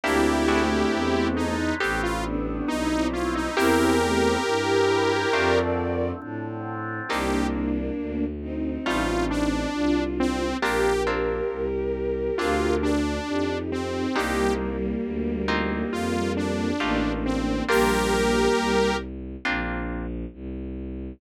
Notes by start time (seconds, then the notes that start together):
0.03 D2 G3 A#3 C4 D4 E4 G4
0.48 A3 C4 D4 E4 F#4 G#4
0.92 E2 F#3 G#3 D4 E4
1.37 D#4
1.80 A1 G3 A3 B3 C4 G4 A4
2.03 F4
2.25 B3 D4
2.68 B1 G3 A3 C4 D#4 E4
2.90 C4 E4
3.13 F4
3.35 D#4
3.56 E2 E3 G3 A#3 C4 E4 G4 A#4
4.02 A3 C4
4.45 G2 E3 G3 C4 E4 G4
5.33 F2 D3 F3 A3 C4 D4 F4 A#4 D5
6.22 A2 D3 F3 C4 D4
7.09 C2 A#3 C4 D4 D#4 G4
7.98 D2
8.41 C4 D#4
8.86 A1 G3 A3 D#4 F4
9.31 D4
9.74 C2 D4 F4
10.20 C4
10.61 A#1 A#3 C4 D4 F4 G4 A#4
11.07 A#3 C4 D4 F4
11.51 C2
12.38 D2 A#3 C4 D4 F4
12.83 D4
13.27 F2 D#4 G4
13.72 C4
14.16 C2 G3 A#3 C4 D4 D#4 G4
15.04 D2
15.48 A#3 C4 D#4 F4
15.91 F2 F4
16.37 D4
16.80 A1 A3 A#3 D4 D#4 F4 G4
17.26 C4
17.68 A#1 G3 A#3 C4 D4 F4 G4 A#4
18.57 C2
19.45 A#1 A#3 C4 D4 F4
20.33 C2